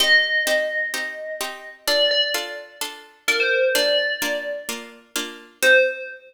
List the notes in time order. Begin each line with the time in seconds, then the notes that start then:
0.00 C4 D#4 G4 D#5
0.47 C4 D#4 G4
0.94 C4 D#4 G4
1.41 C4 D#4 G4
1.88 D4 F4 A4 D5
2.11 D5
2.34 D4 F4 A4
2.81 D4 F4 A4
3.28 D4 F4 A4 A#4
3.40 C5
3.75 A#3 D4 F4 D5
4.22 A#3 D4 F4
4.69 A#3 D4 F4
5.16 A#3 D4 F4
5.62 C4 D#4 G4 C5